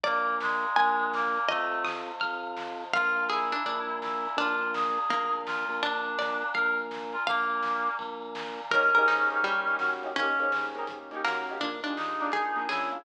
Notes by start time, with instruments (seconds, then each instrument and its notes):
0.03 drawbar organ A#1, clarinet A#3, harpsichord D5, pad 5 (bowed) D5 F5 G#5 A#5, kick, ride
0.27 ride
0.40 clarinet G#3, snare
0.63 ride
0.76 drawbar organ A#1, pad 5 (bowed) D5 F5 G#5 A#5, harpsichord G#5, kick, ride
1.00 ride
1.13 clarinet A#3, snare
1.35 snare, ride
1.48 drawbar organ F2, clarinet A3, pad 5 (bowed) C5 D#5 F5 A5, harpsichord D#5, kick, ride
1.72 ride
1.85 harpsichord D#6, snare
2.08 ride
2.20 drawbar organ F2, pad 5 (bowed) C5 D#5 F5 A5, harpsichord F6, kick, ride
2.43 ride
2.57 snare
2.80 snare, ride
2.93 drawbar organ A#1, clarinet F4, pad 5 (bowed) D5 F5 G#5 A#5, harpsichord F5, kick, ride
3.17 ride
3.29 clarinet E4, harpsichord G#4, snare
3.52 harpsichord D4, ride
3.65 drawbar organ A#1, harpsichord D4, pad 5 (bowed) D5 F5 G#5 A#5, kick, ride
3.89 ride
4.02 clarinet E4, snare
4.25 snare, ride
4.37 drawbar organ A#1, harpsichord D4, clarinet F4, pad 5 (bowed) D5 F5 G#5 A#5, kick, ride
4.61 ride
4.74 clarinet G#4, snare
4.98 ride
5.09 drawbar organ A#1, harpsichord A#3, pad 5 (bowed) D5 F5 G#5 A#5, kick, ride
5.33 ride
5.46 clarinet F4, snare
5.69 drawbar organ A#1, snare, ride
5.83 clarinet D4, harpsichord D4, pad 5 (bowed) D5 F5 G#5 A#5, kick, ride
6.06 ride
6.19 harpsichord D5, snare
6.42 ride
6.54 drawbar organ A#1, clarinet A#4, pad 5 (bowed) D5 F5 G#5 A#5, harpsichord F5, kick, ride
6.78 ride
6.91 snare
7.13 clarinet F4, snare, ride
7.26 drawbar organ A#1, clarinet A#3, pad 5 (bowed) D5 F5 G#5 A#5, harpsichord F5, kick, ride
7.50 ride
7.63 snare
7.87 ride
7.99 drawbar organ A#1, pad 5 (bowed) D5 F5 G#5 A#5, kick, ride
8.22 ride
8.35 snare
8.58 snare, ride
8.71 drawbar organ D#2, acoustic grand piano A#3 C#4, pad 5 (bowed) A#3 C#4 D#4 G4, clarinet C#4, harpsichord A#4, kick, closed hi-hat
8.75 acoustic grand piano D#4 G4
8.95 drawbar organ G#2, acoustic grand piano A#3 C#4 D#4, harpsichord A#4, closed hi-hat
9.00 acoustic grand piano G4
9.08 harpsichord D#4, snare
9.30 acoustic grand piano A#3 C#4 D#4, snare, closed hi-hat
9.35 acoustic grand piano G4
9.43 harpsichord G3, kick, closed hi-hat
9.67 drawbar organ D#2, acoustic grand piano A#3 C#4 D#4, closed hi-hat
9.72 acoustic grand piano G4
9.79 drawbar organ F#2, snare
10.02 acoustic grand piano A#3 C#4 D#4, snare, closed hi-hat
10.07 acoustic grand piano G4
10.16 drawbar organ D#2, pad 5 (bowed) A#3 C#4 D#4 G4, acoustic grand piano A#3 C#4, clarinet C#4, harpsichord C#4, kick, closed hi-hat
10.20 acoustic grand piano D#4 G4
10.39 drawbar organ G#2, acoustic grand piano A#3 C#4 D#4, closed hi-hat
10.44 acoustic grand piano G4
10.52 snare
10.75 acoustic grand piano A#3 C#4 D#4, closed hi-hat
10.80 acoustic grand piano G4
10.87 kick, closed hi-hat
11.11 drawbar organ D#2, acoustic grand piano A#3 C#4 D#4, closed hi-hat
11.17 acoustic grand piano G4
11.24 drawbar organ F#2, harpsichord A#3, snare
11.47 acoustic grand piano A#3 C#4 D#4, snare, closed hi-hat
11.53 acoustic grand piano G4
11.60 drawbar organ A#1, acoustic grand piano A#3 D4 F4, pad 5 (bowed) A#3 D4 F4 G#4, harpsichord D4, kick, closed hi-hat
11.65 acoustic grand piano G#4
11.83 drawbar organ D#2, acoustic grand piano A#3 D4, harpsichord D4, closed hi-hat
11.87 acoustic grand piano F4 G#4
11.96 clarinet D#4, snare
12.20 acoustic grand piano A#3 D4 F4, closed hi-hat
12.25 acoustic grand piano G#4
12.32 harpsichord G#4, kick, closed hi-hat
12.56 drawbar organ A#1, acoustic grand piano A#3 D4 F4, closed hi-hat
12.61 acoustic grand piano G#4
12.69 drawbar organ C#2, clarinet E4, harpsichord G#4, snare
12.91 acoustic grand piano A#3 D4, snare, closed hi-hat
12.96 acoustic grand piano F4 G#4